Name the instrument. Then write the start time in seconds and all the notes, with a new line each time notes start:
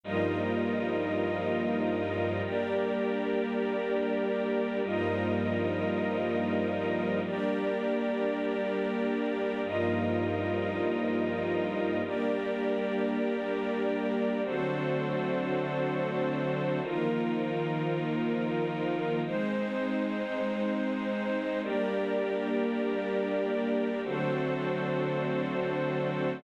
string ensemble 1
0.04 G2 F3 G3 A#3 D#4 F4 A#4 D#5
2.44 G3 A#3 D4 G4 A#4 D5
4.83 G2 F3 G3 A#3 D#4 F4 A#4 D#5
7.24 G3 A#3 D4 G4 A#4 D5
9.64 G2 F3 G3 A#3 D#4 F4 A#4 D#5
12.04 G3 A#3 D4 G4 A#4 D5
14.43 D3 F#3 A3 C4 D4 F#4 A4 C5
16.82 D#3 F3 A#3 D#4 F4 A#4
19.24 G#3 C4 D#4 C5
21.62 G3 A#3 D4 G4 A#4 D5
24.04 D3 F#3 A3 C4 D4 F#4 A4 C5